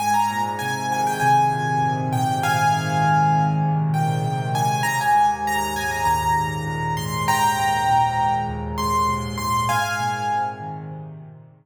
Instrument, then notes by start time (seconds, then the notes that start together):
acoustic grand piano
0.00 G#2 G#5
0.14 A#5
0.30 A#2
0.59 C3 G#5
0.91 D#3 G#5
1.07 G5
1.20 C3 G#5
1.51 A#2
1.82 G#2
2.12 A#2 G5
2.42 C3 F5 G#5
2.73 D#3
3.03 C3
3.33 A#2
3.64 G#2
3.94 A#2 G5
4.24 C3
4.54 D#3 G#5
4.83 D#2 A#5
5.01 G#5
5.15 G#2
5.46 A#2 A#5
5.76 G#2 G#5
5.91 A#5
6.05 D#2 A#5
6.36 G#2
6.67 A#2
6.97 G#2 C6
7.27 D#2 G5 A#5
7.57 G#2
7.88 A#2
8.18 G#2
8.48 D#2
8.78 G#2 C6
9.09 A#2
9.38 G#2 C6
9.69 G#2 F5 G#5
10.00 A#2
10.30 C3
10.61 D#3
10.91 C3
11.21 A#2
11.52 G#2